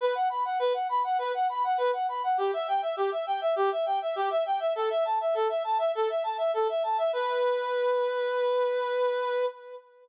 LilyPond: \new Staff { \time 4/4 \key b \minor \tempo 4 = 101 b'16 fis''16 b''16 fis''16 b'16 fis''16 b''16 fis''16 b'16 fis''16 b''16 fis''16 b'16 fis''16 b''16 fis''16 | g'16 e''16 g''16 e''16 g'16 e''16 g''16 e''16 g'16 e''16 g''16 e''16 g'16 e''16 g''16 e''16 | a'16 e''16 a''16 e''16 a'16 e''16 a''16 e''16 a'16 e''16 a''16 e''16 a'16 e''16 a''16 e''16 | b'1 | }